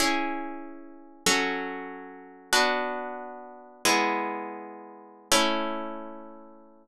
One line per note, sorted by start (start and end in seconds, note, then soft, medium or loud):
0.00 1.24 C#4 medium
0.00 1.24 E4 medium
0.00 1.24 G#4 medium
1.26 2.50 F#3 medium
1.26 2.50 C#4 loud
1.26 2.50 A4 medium
2.53 3.82 B3 medium
2.53 3.82 D4 medium
2.53 3.82 F#4 medium
3.85 5.29 G#3 medium
3.85 5.29 B3 medium
3.85 5.29 E4 medium
5.32 6.87 A3 loud
5.32 6.87 C#4 medium
5.32 6.87 E4 loud